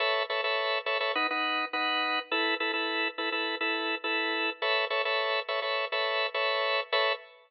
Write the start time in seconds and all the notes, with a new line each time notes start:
0.00 A4 B4 C#5 E5
0.30 A4 B4 C#5 E5
0.44 A4 B4 C#5 E5
0.86 A4 B4 C#5 E5
1.00 A4 B4 C#5 E5
1.15 D#4 B4 F#5
1.31 D#4 B4 F#5
1.73 D#4 B4 F#5
2.31 E4 A4 B4
2.60 E4 A4 B4
2.73 E4 A4 B4
3.18 E4 A4 B4
3.32 E4 A4 B4
3.61 E4 A4 B4
4.04 E4 A4 B4
4.62 A4 B4 C#5 E5
4.90 A4 B4 C#5 E5
5.05 A4 B4 C#5 E5
5.48 A4 B4 C#5 E5
5.62 A4 B4 C#5 E5
5.92 A4 B4 C#5 E5
6.34 A4 B4 C#5 E5
6.92 A4 B4 C#5 E5